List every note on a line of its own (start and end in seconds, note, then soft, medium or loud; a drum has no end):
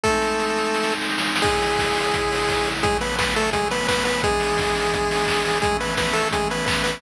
0.03 1.42 G#3 medium
0.03 0.94 A3 loud
0.03 1.42 C4 medium
0.03 1.42 D#4 medium
0.03 0.94 A4 loud
0.03 kick medium
0.03 snare medium
0.22 snare medium
0.39 snare medium
0.57 snare medium
0.74 snare medium
0.83 snare medium
0.92 snare medium
1.01 snare medium
1.09 snare medium
1.18 snare medium
1.27 snare medium
1.36 snare medium
1.42 2.83 C#3 medium
1.42 2.69 G#3 loud
1.42 2.83 G#3 medium
1.42 2.83 E4 medium
1.42 2.69 G#4 loud
1.42 kick medium
1.42 crash medium
1.62 open hi-hat medium
1.79 kick medium
1.79 snare medium
1.96 open hi-hat medium
2.14 kick medium
2.14 closed hi-hat loud
2.32 open hi-hat medium
2.49 kick medium
2.49 snare medium
2.66 open hi-hat medium
2.83 4.22 C#3 medium
2.83 4.22 F#3 medium
2.83 2.98 G#3 loud
2.83 4.22 A3 medium
2.83 2.98 G#4 loud
2.83 kick medium
2.83 closed hi-hat medium
3.01 3.16 B3 medium
3.01 3.16 B4 loud
3.01 open hi-hat medium
3.19 3.34 B3 medium
3.19 3.34 B4 medium
3.19 kick medium
3.19 snare medium
3.36 3.50 A3 loud
3.36 3.50 A4 loud
3.36 open hi-hat medium
3.53 3.68 G#3 medium
3.53 3.68 G#4 loud
3.53 kick medium
3.53 closed hi-hat medium
3.71 3.87 B3 loud
3.71 3.87 B4 loud
3.71 open hi-hat medium
3.88 4.04 B3 loud
3.88 4.04 B4 loud
3.88 kick medium
3.88 clap loud
4.05 4.22 B3 loud
4.05 4.22 B4 loud
4.05 open hi-hat medium
4.23 5.61 E3 medium
4.23 5.61 G#3 medium
4.23 5.59 G#3 loud
4.23 5.61 B3 medium
4.23 5.61 D4 medium
4.23 5.59 G#4 loud
4.23 kick medium
4.23 closed hi-hat medium
4.40 open hi-hat medium
4.58 kick medium
4.58 snare medium
4.75 open hi-hat medium
4.93 kick medium
4.93 closed hi-hat medium
5.11 open hi-hat medium
5.27 kick medium
5.27 clap medium
5.45 open hi-hat medium
5.62 7.01 E3 medium
5.62 5.77 G#3 loud
5.62 7.01 A3 medium
5.62 7.01 C#4 medium
5.62 5.77 G#4 loud
5.62 kick medium
5.62 closed hi-hat medium
5.80 5.95 B3 medium
5.80 5.95 B4 medium
5.80 open hi-hat medium
5.97 6.14 B3 medium
5.97 6.14 B4 loud
5.97 kick medium
5.97 snare medium
6.13 6.29 A3 loud
6.13 6.29 A4 loud
6.13 open hi-hat medium
6.32 6.49 G#3 medium
6.32 6.49 G#4 loud
6.32 kick medium
6.32 closed hi-hat medium
6.50 6.65 B3 medium
6.50 6.65 B4 medium
6.50 open hi-hat medium
6.66 6.83 B3 medium
6.66 6.83 B4 medium
6.66 kick medium
6.66 clap loud
6.84 7.00 B3 medium
6.84 7.00 B4 loud
6.84 open hi-hat medium